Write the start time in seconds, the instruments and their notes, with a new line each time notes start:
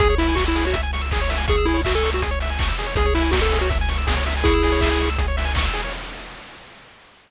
0.00 synth bass 1 C#2, lead 1 (square) G#4, kick, closed hi-hat
0.10 lead 1 (square) C#5
0.18 lead 1 (square) E4 E5, open hi-hat
0.29 lead 1 (square) G#5
0.35 lead 1 (square) F#4 C#6, kick, clap
0.47 lead 1 (square) E4 E6
0.55 lead 1 (square) G#4, open hi-hat
0.65 lead 1 (square) F#4 C#5
0.73 lead 1 (square) E5, kick, closed hi-hat
0.83 lead 1 (square) G#5
0.93 lead 1 (square) C#6, open hi-hat
1.01 lead 1 (square) E6
1.11 lead 1 (square) G#4, kick, clap
1.21 lead 1 (square) C#5
1.29 lead 1 (square) E5, open hi-hat
1.37 lead 1 (square) G#5
1.48 lead 1 (square) G#4 C#6, kick, closed hi-hat
1.58 lead 1 (square) E6
1.65 lead 1 (square) E4 G#4, open hi-hat
1.74 lead 1 (square) C#5
1.84 lead 1 (square) F#4 E5, kick, clap
1.95 lead 1 (square) A4 G#5
2.03 lead 1 (square) C#6, open hi-hat
2.13 lead 1 (square) F#4 E6
2.22 lead 1 (square) G#4, kick, closed hi-hat
2.31 lead 1 (square) C#5
2.40 lead 1 (square) E5, open hi-hat
2.50 lead 1 (square) G#5
2.59 lead 1 (square) C#6, kick, clap
2.68 lead 1 (square) E6
2.79 lead 1 (square) G#4, open hi-hat
2.86 lead 1 (square) C#5
2.95 synth bass 1 C#2, lead 1 (square) G#4, kick, closed hi-hat
3.06 lead 1 (square) C#5
3.15 lead 1 (square) E4 E5, open hi-hat
3.22 lead 1 (square) G#5
3.31 lead 1 (square) F#4 C#6, kick, snare
3.42 lead 1 (square) A4 E6
3.52 lead 1 (square) G#4, open hi-hat
3.61 lead 1 (square) F#4 C#5
3.70 lead 1 (square) E5, kick, closed hi-hat
3.81 lead 1 (square) G#5
3.89 lead 1 (square) C#6, open hi-hat
3.98 lead 1 (square) E6
4.07 lead 1 (square) G#4, kick, snare
4.16 lead 1 (square) C#5
4.26 lead 1 (square) E5, open hi-hat
4.37 lead 1 (square) G#5
4.44 lead 1 (square) E4 G#4 C#6, kick, closed hi-hat
4.54 lead 1 (square) E6
4.63 lead 1 (square) G#4, open hi-hat
4.72 lead 1 (square) C#5
4.81 lead 1 (square) E5, kick, clap
4.91 lead 1 (square) G#5
5.00 lead 1 (square) C#6, open hi-hat
5.10 lead 1 (square) E6
5.18 lead 1 (square) G#4, kick, closed hi-hat
5.28 lead 1 (square) C#5
5.37 lead 1 (square) E5, open hi-hat
5.45 lead 1 (square) G#5
5.55 lead 1 (square) C#6, kick, clap
5.66 lead 1 (square) E6
5.73 lead 1 (square) G#4, open hi-hat
5.84 lead 1 (square) C#5